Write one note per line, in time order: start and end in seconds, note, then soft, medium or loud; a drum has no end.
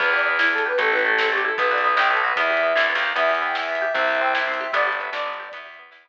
0.00 0.72 E2 loud
0.00 0.26 B3 medium
0.00 0.10 B4 loud
0.00 kick loud
0.00 crash loud
0.13 0.65 G4 medium
0.13 0.25 D5 medium
0.19 closed hi-hat medium
0.26 0.52 B3 medium
0.26 0.38 B4 loud
0.39 0.77 E4 medium
0.39 0.51 B4 medium
0.39 snare loud
0.52 0.78 B3 medium
0.52 0.63 A4 loud
0.58 closed hi-hat medium
0.66 0.78 G4 medium
0.66 0.79 B4 loud
0.78 1.51 A1 loud
0.78 1.05 A3 medium
0.78 0.92 A4 loud
0.78 kick loud
0.78 closed hi-hat loud
0.92 1.44 E4 medium
0.92 1.04 B4 loud
0.99 closed hi-hat medium
1.05 1.31 A3 medium
1.05 1.16 A4 loud
1.17 1.56 C4 medium
1.17 1.28 A4 loud
1.17 snare loud
1.32 1.57 A3 medium
1.32 1.44 G4 loud
1.38 closed hi-hat medium
1.45 1.57 E4 medium
1.45 1.56 A4 loud
1.58 1.95 B1 loud
1.58 1.84 B3 medium
1.58 1.70 B4 loud
1.58 kick loud
1.58 closed hi-hat loud
1.71 2.23 F#4 medium
1.71 1.83 D5 loud
1.78 closed hi-hat medium
1.84 2.10 B3 medium
1.84 1.96 B4 loud
1.96 2.33 B1 medium
1.96 2.35 D#4 medium
1.96 2.08 G5 loud
1.96 snare loud
2.10 2.36 B3 medium
2.10 2.21 A4 medium
2.17 closed hi-hat medium
2.24 2.36 F#4 medium
2.24 2.37 B4 loud
2.36 2.73 E2 medium
2.36 2.63 B3 loud
2.36 2.83 E5 loud
2.36 kick loud
2.36 closed hi-hat loud
2.50 3.02 G4 medium
2.57 closed hi-hat medium
2.63 2.89 B3 medium
2.75 2.93 D2 medium
2.75 3.14 E4 medium
2.75 snare loud
2.89 3.14 B3 medium
2.95 3.13 D#2 medium
2.95 open hi-hat medium
3.03 3.15 G4 medium
3.16 3.88 E2 medium
3.16 3.42 B3 medium
3.16 3.40 E5 loud
3.16 kick loud
3.16 closed hi-hat loud
3.29 3.81 G4 medium
3.35 closed hi-hat medium
3.42 3.68 B3 medium
3.42 3.56 G5 medium
3.55 3.93 E4 medium
3.55 3.93 E5 loud
3.55 snare loud
3.68 3.93 B3 medium
3.75 closed hi-hat medium
3.82 3.94 G4 medium
3.93 4.67 C2 medium
3.93 4.21 C4 medium
3.93 4.17 E5 loud
3.93 kick loud
3.93 closed hi-hat medium
4.08 4.60 G4 medium
4.15 closed hi-hat medium
4.21 4.47 C4 medium
4.21 4.33 G5 loud
4.34 4.72 E4 medium
4.34 4.72 E5 medium
4.34 snare loud
4.47 4.72 C4 medium
4.54 closed hi-hat medium
4.61 4.73 G4 medium
4.73 5.10 G1 medium
4.73 5.00 B3 medium
4.73 4.97 D5 loud
4.73 kick medium
4.73 closed hi-hat loud
4.87 5.39 G4 medium
4.92 closed hi-hat medium
4.99 5.26 B3 medium
4.99 5.11 E5 medium
5.12 5.49 G1 medium
5.12 5.51 D4 medium
5.12 5.49 D5 loud
5.12 snare loud
5.26 5.51 B3 medium
5.33 closed hi-hat medium
5.39 5.52 G4 medium
5.52 5.90 E2 medium
5.52 5.78 B3 medium
5.52 5.75 E5 medium
5.52 kick loud
5.52 closed hi-hat loud
5.66 6.09 G4 medium
5.74 closed hi-hat medium
5.79 6.05 B3 medium
5.91 6.09 E2 medium
5.91 6.09 E4 medium
5.91 snare loud
6.05 6.09 B3 medium